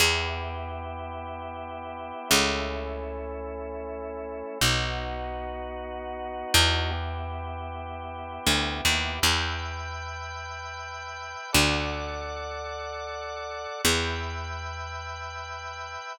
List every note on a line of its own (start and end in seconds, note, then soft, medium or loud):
0.00 2.12 E2 loud
0.00 2.29 B3 medium
0.00 2.29 E4 medium
0.00 2.29 G4 medium
2.30 4.43 C#2 loud
2.30 4.58 A3 medium
2.30 4.58 C#4 medium
2.30 4.58 E4 medium
4.61 6.44 B1 medium
4.61 6.90 B3 medium
4.61 6.91 D#4 medium
4.61 6.91 F#4 medium
6.54 8.39 E2 loud
6.91 9.19 B3 medium
6.91 9.19 E4 medium
6.91 9.19 G4 medium
8.46 8.81 D2 medium
8.85 9.20 D#2 loud
9.22 11.35 E2 loud
9.22 11.51 B4 medium
9.22 11.51 E5 medium
9.22 11.51 G5 medium
11.53 13.67 D2 loud
11.53 13.81 A4 medium
11.53 13.81 D5 medium
11.53 13.81 F#5 medium
13.84 15.97 E2 loud
13.84 16.13 B4 medium
13.84 16.13 E5 medium
13.84 16.13 G5 medium